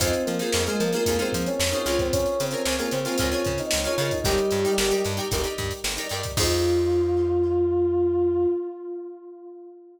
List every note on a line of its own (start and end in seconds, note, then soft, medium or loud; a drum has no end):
0.00 0.15 F2 medium
0.00 0.23 C4 medium
0.00 0.32 D#4 medium
0.00 0.32 F4 loud
0.00 0.32 G#4 medium
0.00 0.23 C5 medium
0.00 0.32 C5 medium
0.00 kick medium
0.00 closed hi-hat loud
0.13 closed hi-hat medium
0.25 0.42 F3 medium
0.25 0.63 A#3 medium
0.25 0.63 A#4 medium
0.25 closed hi-hat medium
0.39 0.50 D#4 medium
0.39 0.50 F4 medium
0.39 0.50 G#4 medium
0.39 0.50 C5 medium
0.39 closed hi-hat medium
0.52 0.68 F2 medium
0.52 0.64 D#4 medium
0.52 0.64 F4 medium
0.52 0.64 G#4 medium
0.52 snare loud
0.57 0.64 C5 medium
0.66 0.79 G#3 medium
0.66 0.88 D#4 medium
0.66 0.88 F4 medium
0.66 0.79 G#4 medium
0.66 0.88 G#4 medium
0.66 0.88 C5 medium
0.66 closed hi-hat medium
0.80 0.95 F3 medium
0.80 0.93 A#3 medium
0.80 0.93 A#4 medium
0.80 closed hi-hat medium
0.93 1.17 A#3 medium
0.93 1.04 D#4 medium
0.93 1.04 F4 medium
0.93 1.04 G#4 medium
0.93 1.17 A#4 medium
0.93 1.04 C5 medium
0.93 closed hi-hat medium
1.06 1.22 F2 medium
1.06 1.17 D#4 medium
1.06 1.17 F4 medium
1.06 1.17 G#4 medium
1.06 1.17 C5 medium
1.06 kick medium
1.06 closed hi-hat loud
1.19 1.46 C4 medium
1.19 1.61 D#4 medium
1.19 1.61 F4 medium
1.19 1.61 G#4 medium
1.19 1.46 C5 medium
1.19 1.61 C5 medium
1.19 closed hi-hat medium
1.32 1.49 F3 medium
1.32 kick medium
1.32 closed hi-hat medium
1.46 1.69 C#4 medium
1.46 1.69 C#5 medium
1.46 closed hi-hat medium
1.60 1.74 F2 medium
1.60 snare loud
1.72 1.95 C#4 medium
1.72 1.83 D#4 medium
1.72 1.83 F4 medium
1.72 1.83 G#4 medium
1.72 1.83 C5 medium
1.72 1.95 C#5 medium
1.72 closed hi-hat medium
1.85 2.27 C#2 medium
1.85 2.44 F4 medium
1.85 2.44 G#4 medium
1.85 2.44 A#4 loud
1.85 snare soft
1.85 closed hi-hat medium
1.89 2.44 C#5 medium
1.99 2.12 C4 medium
1.99 2.12 C5 medium
1.99 kick medium
1.99 closed hi-hat medium
2.12 2.38 C#4 medium
2.12 2.38 C#5 loud
2.12 kick loud
2.12 closed hi-hat loud
2.26 closed hi-hat medium
2.40 2.55 C#3 medium
2.40 2.76 C4 medium
2.40 2.76 C5 medium
2.40 closed hi-hat medium
2.51 2.62 F4 medium
2.51 2.62 G#4 medium
2.51 2.62 A#4 medium
2.51 closed hi-hat medium
2.55 2.62 C#5 medium
2.65 2.81 C#2 medium
2.65 2.76 F4 medium
2.65 2.76 G#4 medium
2.65 2.76 A#4 medium
2.65 2.76 C#5 medium
2.65 snare loud
2.79 2.91 A#3 medium
2.79 3.00 F4 medium
2.79 3.00 G#4 medium
2.79 2.91 A#4 medium
2.79 3.00 A#4 medium
2.79 3.00 C#5 medium
2.79 closed hi-hat medium
2.91 3.07 C#3 medium
2.91 3.04 C4 medium
2.91 3.04 C5 medium
2.91 closed hi-hat medium
3.05 3.29 C4 medium
3.05 3.16 F4 medium
3.05 3.16 G#4 medium
3.05 3.16 A#4 medium
3.05 3.29 C5 medium
3.05 closed hi-hat medium
3.09 3.16 C#5 medium
3.18 3.35 C#2 medium
3.18 3.30 F4 medium
3.18 3.30 G#4 medium
3.18 3.30 A#4 medium
3.18 kick medium
3.18 closed hi-hat loud
3.22 3.30 C#5 medium
3.32 3.56 C#4 medium
3.32 3.74 F4 medium
3.32 3.74 G#4 medium
3.32 3.74 A#4 medium
3.32 3.56 C#5 medium
3.32 3.74 C#5 medium
3.32 closed hi-hat medium
3.44 3.61 C#3 medium
3.44 kick medium
3.44 closed hi-hat medium
3.58 3.84 D#4 medium
3.58 3.84 D#5 medium
3.58 snare soft
3.58 closed hi-hat medium
3.71 3.88 C#2 medium
3.71 snare loud
3.84 4.11 C#4 medium
3.84 3.96 F4 medium
3.84 3.96 G#4 medium
3.84 3.96 A#4 medium
3.84 4.11 C#5 medium
3.84 closed hi-hat medium
3.88 3.96 C#5 medium
3.98 4.12 C#3 medium
3.98 4.20 F4 medium
3.98 4.20 G#4 medium
3.98 4.20 A#4 medium
3.98 closed hi-hat medium
4.02 4.20 C#5 medium
4.11 4.24 D#4 medium
4.11 4.24 D#5 medium
4.11 kick medium
4.11 closed hi-hat medium
4.24 4.40 G1 medium
4.24 4.95 G3 medium
4.24 4.57 D#4 loud
4.24 4.95 G4 loud
4.24 4.57 G4 loud
4.24 4.57 A#4 medium
4.24 4.57 D5 medium
4.24 kick loud
4.24 closed hi-hat medium
4.38 closed hi-hat medium
4.51 4.66 G2 medium
4.51 closed hi-hat medium
4.65 4.75 D#4 medium
4.65 4.75 G4 medium
4.65 4.75 A#4 medium
4.65 4.75 D5 medium
4.65 closed hi-hat medium
4.78 4.92 G1 medium
4.78 4.88 D#4 medium
4.78 4.88 G4 medium
4.78 4.88 A#4 medium
4.78 4.88 D5 medium
4.78 snare loud
4.91 5.12 D#4 medium
4.91 5.12 G4 medium
4.91 5.12 A#4 medium
4.91 5.12 D5 medium
4.91 closed hi-hat medium
5.04 5.20 G2 medium
5.04 snare soft
5.04 closed hi-hat medium
5.17 5.28 D#4 medium
5.17 5.28 G4 medium
5.17 5.28 A#4 medium
5.17 5.28 D5 medium
5.17 closed hi-hat medium
5.31 5.47 G1 medium
5.31 5.42 D#4 medium
5.31 5.42 G4 medium
5.31 5.42 A#4 medium
5.31 5.42 D5 medium
5.31 kick medium
5.31 closed hi-hat loud
5.44 5.86 D#4 medium
5.44 5.86 G4 medium
5.44 5.86 A#4 medium
5.44 5.86 D5 medium
5.44 closed hi-hat medium
5.58 5.73 G2 medium
5.58 kick medium
5.58 closed hi-hat medium
5.71 closed hi-hat medium
5.84 5.99 G1 medium
5.84 snare loud
5.97 6.08 D#4 medium
5.97 6.08 G4 medium
5.97 6.08 A#4 medium
5.97 6.08 D5 medium
5.97 closed hi-hat medium
6.09 6.26 G2 medium
6.09 6.32 D#4 medium
6.09 6.32 G4 medium
6.09 6.32 A#4 medium
6.09 closed hi-hat medium
6.14 6.32 D5 medium
6.23 kick medium
6.23 snare soft
6.23 closed hi-hat medium
6.37 8.46 F2 loud
6.37 8.46 D#4 loud
6.37 8.46 F4 loud
6.37 8.48 F4 loud
6.37 8.46 G#4 loud
6.37 8.46 C5 medium
6.37 kick loud
6.37 crash loud